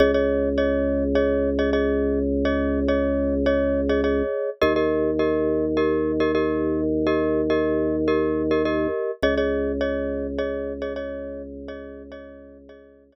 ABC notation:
X:1
M:4/4
L:1/16
Q:1/4=104
K:Dblyd
V:1 name="Glockenspiel"
[Ade] [Ade]3 [Ade]4 [Ade]3 [Ade] [Ade]4- | [Ade] [Ade]3 [Ade]4 [Ade]3 [Ade] [Ade]4 | [GBe] [GBe]3 [GBe]4 [GBe]3 [GBe] [GBe]4- | [GBe] [GBe]3 [GBe]4 [GBe]3 [GBe] [GBe]4 |
[Ade] [Ade]3 [Ade]4 [Ade]3 [Ade] [Ade]4- | [Ade] [Ade]3 [Ade]4 [Ade]3 [Ade] z4 |]
V:2 name="Drawbar Organ" clef=bass
D,,16- | D,,16 | E,,16- | E,,16 |
D,,16- | D,,16 |]